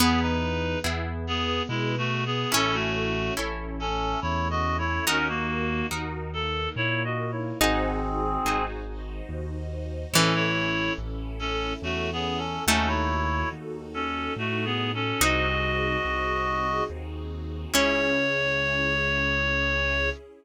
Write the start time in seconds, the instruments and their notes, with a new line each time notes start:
0.00 acoustic grand piano E2, orchestral harp B3 E4 G#4, harpsichord B3, clarinet B3 G#4, string ensemble 1 B3 E4 G#4
0.21 clarinet D#4 B4
0.84 acoustic grand piano E2, orchestral harp B3 E4 G#4
1.26 string ensemble 1 B3 G#4 B4, clarinet B3 G#4
1.69 acoustic grand piano B2, clarinet G#3 E4
1.98 clarinet A3 F#4
2.25 clarinet B3 G#4
2.52 acoustic grand piano A1, orchestral harp C#4 E4 A4, string ensemble 1 C#4 E4 A4, harpsichord C#4, clarinet C#4 A4
2.74 clarinet A3 F#4
3.37 acoustic grand piano A1, orchestral harp C#4 E4 A4
3.80 string ensemble 1 A3 C#4 A4, clarinet C#4 A4
4.21 acoustic grand piano E2, clarinet E4 C#5
4.50 clarinet F#4 D#5
4.78 clarinet E4 C#5
5.05 acoustic grand piano D#2, clarinet C#4 A#4, string ensemble 1 D#4 F#4 A#4, orchestral harp D#4 F#4 A#4, harpsichord D#4
5.28 clarinet A#3 F#4
5.91 acoustic grand piano D#2, orchestral harp D#4 F#4 A#4
6.34 string ensemble 1 A#3 D#4 A#4, clarinet A4
6.76 acoustic grand piano A#2, clarinet E4 C#5
7.04 clarinet F#4 D#5
7.32 clarinet E4 C#5
7.59 acoustic grand piano G#1, clarinet C4 G#4, string ensemble 1 D#4 F#4 G#4 C5, harpsichord D#4, orchestral harp D#4 F#4 G#4 C5
8.45 acoustic grand piano G#1, orchestral harp D#4 F#4 G#4 C5
8.88 string ensemble 1 D#4 F#4 C5 D#5
9.29 acoustic grand piano D#2
10.13 acoustic grand piano A1, harpsichord E3, string ensemble 1 C#4 E4 A4, clarinet C#4 A4, orchestral harp E4 A4 C#5
10.35 clarinet E4 C#5
10.98 acoustic grand piano A1
11.39 clarinet C#4 A4
11.82 acoustic grand piano E2, clarinet A3 F#4
12.12 clarinet B3 G#4
12.37 clarinet C#4 A4
12.67 acoustic grand piano D#2, harpsichord A3, clarinet C#4 A4, string ensemble 1 D#4 F#4 A4, orchestral harp D#4 F#4 A4
12.87 clarinet E4 C#5
13.52 acoustic grand piano D#2
13.94 clarinet C#4 A4
14.36 acoustic grand piano A2, clarinet A3 F#4
14.65 clarinet B3 G#4
14.94 clarinet C#4 A4
15.21 acoustic grand piano C2, orchestral harp C4 D#4 F#4 G#4, string ensemble 1 C4 D#4 F#4 G#4, harpsichord D#4, clarinet F#4 D#5
16.05 acoustic grand piano C2
16.90 acoustic grand piano D#2
17.74 acoustic grand piano C#2, orchestral harp C#4 E4 G#4, string ensemble 1 C#4 E4 G#4, harpsichord C#4, clarinet C#5